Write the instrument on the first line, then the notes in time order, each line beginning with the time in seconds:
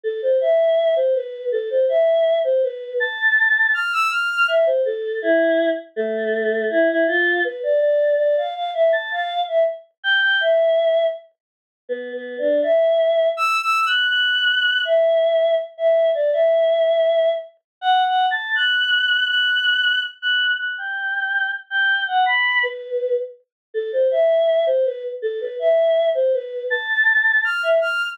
choir aahs
0.03 A4
0.22 C5
0.41 E5
0.96 C5
1.15 B4
1.52 A4
1.70 C5
1.89 E5
2.44 C5
2.63 B4
3.00 A5
3.74 F6
3.92 E6
4.11 F6
4.48 E5
4.66 C5
4.85 A4
5.22 E4
5.96 A3
6.70 E4
6.89 E4
7.07 F4
7.44 B4
7.63 D5
7.81 D5
8.18 D5
8.37 F5
8.55 F5
8.74 E5
8.92 A5
9.11 F5
9.48 E5
10.03 G5
10.22 G5
10.41 E5
11.89 B3
12.13 B3
12.38 D4
12.63 E5
13.37 E6
13.61 E6
13.86 F#6
14.11 F#6
14.85 E5
15.78 E5
16.15 D5
16.33 E5
17.81 F#5
18.06 F#5
18.31 A5
18.55 F#6
19.29 F#6
20.22 F#6
20.59 F#6
20.78 G5
21.70 G5
22.07 F#5
22.26 B5
22.63 B4
23.74 A4
23.92 C5
24.11 E5
24.66 C5
24.85 B4
25.22 A4
25.41 B4
25.59 E5
26.15 C5
26.33 B4
26.70 A5
27.44 F6
27.63 E5
27.81 F6